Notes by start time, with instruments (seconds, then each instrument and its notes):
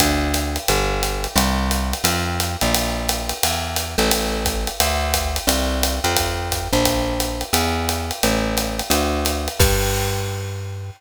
0.00 electric bass (finger) D2, kick, ride
0.34 hi-hat pedal, ride
0.56 ride
0.68 electric bass (finger) G1, ride
1.03 hi-hat pedal, ride
1.24 ride
1.36 electric bass (finger) C2, ride
1.71 hi-hat pedal, ride
1.93 ride
2.04 electric bass (finger) F2, ride
2.40 hi-hat pedal, ride
2.61 electric bass (finger) A#1, ride
2.74 ride
3.09 hi-hat pedal, ride
3.29 ride
3.43 electric bass (finger) E2, ride
3.76 hi-hat pedal, ride
3.98 electric bass (finger) A1, ride
4.11 ride
4.45 kick, hi-hat pedal, ride
4.67 ride
4.80 electric bass (finger) D2, ride
5.14 kick, hi-hat pedal, ride
5.36 ride
5.47 electric bass (finger) C2, ride
5.83 hi-hat pedal, ride
6.04 electric bass (finger) F2, ride
6.16 kick, ride
6.51 kick, hi-hat pedal, ride
6.73 electric bass (finger) A#1, ride
6.85 kick, ride
7.20 hi-hat pedal, ride
7.41 ride
7.53 electric bass (finger) E2, ride
7.89 hi-hat pedal, ride
8.11 ride
8.23 electric bass (finger) A1, ride
8.57 hi-hat pedal, ride
8.79 ride
8.90 electric bass (finger) D2, ride
9.25 hi-hat pedal, ride
9.48 ride
9.59 electric bass (finger) G2, kick, crash